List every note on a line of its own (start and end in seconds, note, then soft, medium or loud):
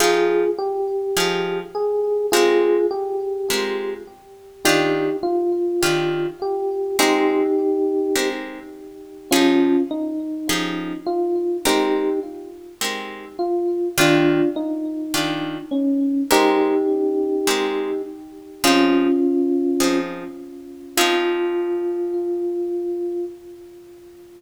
0.00 0.44 F3 medium
0.00 0.44 D#4 loud
0.00 0.50 F4 medium
0.00 0.44 G4 loud
0.00 0.50 G#4 loud
0.00 0.44 G#4 medium
0.58 1.59 G4 loud
1.17 1.61 F3 medium
1.17 1.61 D#4 medium
1.17 1.61 G4 medium
1.17 1.61 G#4 medium
1.75 2.27 G#4 loud
2.32 2.77 G#3 loud
2.32 2.77 C4 medium
2.32 2.86 F4 loud
2.32 2.77 G4 loud
2.32 2.86 G#4 loud
2.32 2.77 A#4 loud
2.91 3.93 G4 medium
3.50 3.94 G#3 medium
3.50 3.94 C4 medium
3.50 3.94 G4 medium
3.50 3.94 A#4 medium
4.65 5.09 D#3 medium
4.65 5.09 D4 loud
4.65 5.16 D#4 medium
4.65 5.09 F4 loud
4.65 5.16 G4 loud
4.65 5.09 G4 loud
5.23 6.28 F4 loud
5.83 6.27 D#3 medium
5.83 6.27 D4 medium
5.83 6.27 F4 medium
5.83 6.27 G4 medium
6.42 6.97 G4 medium
6.99 7.43 G#3 loud
6.99 7.43 C4 loud
6.99 8.29 D#4 loud
6.99 7.43 G4 loud
6.99 8.29 G4 loud
6.99 7.43 A#4 medium
8.16 8.60 G#3 medium
8.16 8.60 C4 medium
8.16 8.60 G4 medium
8.16 8.60 A#4 medium
9.31 9.76 F3 medium
9.31 9.82 C#4 medium
9.31 9.76 D#4 loud
9.31 9.82 F4 loud
9.31 9.76 G4 loud
9.31 9.76 G#4 loud
9.91 10.99 D#4 medium
10.49 10.93 F3 medium
10.49 10.93 D#4 medium
10.49 10.93 G4 medium
10.49 10.93 G#4 medium
11.06 11.57 F4 medium
11.65 12.09 G#3 medium
11.65 12.09 C4 loud
11.65 12.20 D#4 medium
11.65 12.09 G4 medium
11.65 12.20 G4 loud
11.65 12.09 A#4 loud
12.81 13.25 G#3 medium
12.81 13.25 C4 medium
12.81 13.25 G4 medium
12.81 13.25 A#4 medium
13.39 13.89 F4 medium
13.98 14.42 D#3 loud
13.98 14.42 D4 loud
13.98 14.49 D4 medium
13.98 14.42 F4 loud
13.98 14.49 F4 loud
13.98 14.42 G4 medium
14.56 15.57 D#4 medium
15.14 15.58 D#3 medium
15.14 15.58 D4 medium
15.14 15.58 F4 medium
15.14 15.58 G4 medium
15.71 16.23 C#4 medium
16.31 16.75 G#3 loud
16.31 16.75 C4 medium
16.31 18.02 D#4 loud
16.31 16.75 G4 loud
16.31 18.02 G4 loud
16.31 16.75 A#4 loud
17.47 17.91 G#3 medium
17.47 17.91 C4 medium
17.47 17.91 G4 medium
17.47 17.91 A#4 medium
18.64 19.08 F3 loud
18.64 19.08 C4 loud
18.64 19.98 C#4 medium
18.64 19.08 D#4 medium
18.64 19.98 F4 loud
18.64 19.08 G#4 loud
19.80 20.24 F3 medium
19.80 20.24 C4 medium
19.80 20.24 D#4 medium
19.80 20.24 G#4 medium
20.97 23.25 F3 loud
20.97 23.25 C4 loud
20.97 23.25 D#4 loud
20.97 23.25 F4 loud
20.97 23.25 G#4 loud